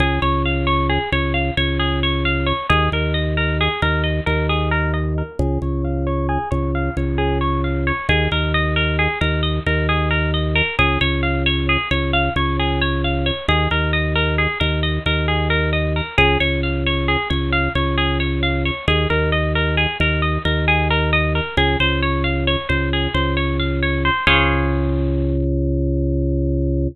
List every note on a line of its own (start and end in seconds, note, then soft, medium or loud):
0.00 0.19 C#2 medium
0.00 0.20 G#4 medium
0.22 0.99 C#2 medium
0.22 0.42 C#5 medium
0.45 0.66 F5 medium
0.67 0.87 C#5 medium
0.90 1.10 G#4 medium
1.12 1.51 C#2 medium
1.12 1.33 C#5 medium
1.34 1.54 F5 medium
1.57 2.53 C#2 medium
1.57 1.78 C#5 medium
1.79 2.00 G#4 medium
2.03 2.23 C#5 medium
2.25 2.45 F5 medium
2.46 2.67 C#5 medium
2.69 2.89 D#2 medium
2.69 2.90 G#4 medium
2.92 3.69 D#2 medium
2.92 3.13 A#4 medium
3.14 3.34 D#5 medium
3.37 3.57 A#4 medium
3.61 3.81 G#4 medium
3.82 4.20 D#2 medium
3.82 4.03 A#4 medium
4.04 4.24 D#5 medium
4.26 5.23 D#2 medium
4.26 4.47 A#4 medium
4.49 4.70 G#4 medium
4.71 4.92 A#4 medium
4.94 5.14 D#5 medium
5.18 5.38 A#4 medium
5.39 5.58 C#2 medium
5.39 5.60 G#4 loud
5.62 6.38 C#2 medium
5.62 5.82 C#5 medium
5.84 6.05 F5 medium
6.07 6.27 C#5 medium
6.29 6.49 G#4 medium
6.51 6.90 C#2 medium
6.51 6.71 C#5 medium
6.75 6.95 F5 medium
6.97 7.92 C#2 medium
6.97 7.17 C#5 medium
7.18 7.38 G#4 medium
7.41 7.61 C#5 medium
7.64 7.84 F5 medium
7.87 8.07 C#5 medium
8.09 8.28 D#2 medium
8.09 8.29 G#4 medium
8.31 9.08 D#2 medium
8.31 8.52 A#4 medium
8.54 8.74 D#5 medium
8.76 8.96 A#4 medium
8.99 9.19 G#4 medium
9.21 9.60 D#2 medium
9.21 9.41 A#4 medium
9.43 9.63 D#5 medium
9.66 10.62 D#2 medium
9.66 9.87 A#4 medium
9.89 10.09 G#4 medium
10.11 10.31 A#4 medium
10.34 10.54 D#5 medium
10.55 10.76 A#4 medium
10.79 10.98 C#2 medium
10.79 10.99 G#4 medium
11.01 11.77 C#2 medium
11.01 11.21 C#5 medium
11.23 11.43 F5 medium
11.46 11.66 C#5 medium
11.69 11.89 G#4 medium
11.91 12.29 C#2 medium
11.91 12.11 C#5 medium
12.13 12.34 F5 medium
12.36 13.31 C#2 medium
12.36 12.57 C#5 medium
12.59 12.80 G#4 medium
12.81 13.02 C#5 medium
13.04 13.25 F5 medium
13.26 13.46 C#5 medium
13.48 13.68 D#2 medium
13.48 13.69 G#4 medium
13.71 14.47 D#2 medium
13.71 13.91 A#4 medium
13.93 14.13 D#5 medium
14.15 14.36 A#4 medium
14.38 14.58 G#4 medium
14.60 14.99 D#2 medium
14.60 14.80 A#4 medium
14.83 15.03 D#5 medium
15.06 16.01 D#2 medium
15.06 15.26 A#4 medium
15.28 15.48 G#4 medium
15.50 15.70 A#4 medium
15.73 15.93 D#5 medium
15.96 16.16 A#4 medium
16.18 16.37 C#2 medium
16.18 16.38 G#4 loud
16.40 17.17 C#2 medium
16.40 16.60 C#5 medium
16.63 16.83 F5 medium
16.86 17.07 C#5 medium
17.08 17.28 G#4 medium
17.30 17.69 C#2 medium
17.30 17.50 C#5 medium
17.52 17.73 F5 medium
17.75 18.71 C#2 medium
17.75 17.96 C#5 medium
17.98 18.18 G#4 medium
18.20 18.40 C#5 medium
18.43 18.63 F5 medium
18.65 18.86 C#5 medium
18.88 19.07 D#2 medium
18.88 19.08 G#4 medium
19.10 19.87 D#2 medium
19.10 19.30 A#4 medium
19.32 19.52 D#5 medium
19.55 19.76 A#4 medium
19.77 19.97 G#4 medium
20.00 20.38 D#2 medium
20.00 20.21 A#4 medium
20.22 20.42 D#5 medium
20.45 21.41 D#2 medium
20.45 20.65 A#4 medium
20.68 20.88 G#4 medium
20.90 21.11 A#4 medium
21.13 21.33 D#5 medium
21.35 21.55 A#4 medium
21.57 21.76 C#2 medium
21.57 21.78 G#4 medium
21.80 22.56 C#2 medium
21.80 22.00 C5 medium
22.02 22.23 C#5 medium
22.24 22.44 F5 medium
22.47 22.68 C#5 medium
22.69 23.08 C#2 medium
22.69 22.89 C5 medium
22.93 23.13 G#4 medium
23.14 24.10 C#2 medium
23.14 23.35 C5 medium
23.37 23.57 C#5 medium
23.59 23.80 F5 medium
23.83 24.03 C#5 medium
24.05 24.25 C5 medium
24.27 26.88 C#2 loud
24.27 26.88 G#4 loud
24.27 26.88 C5 loud
24.27 26.88 C#5 loud
24.27 26.88 F5 loud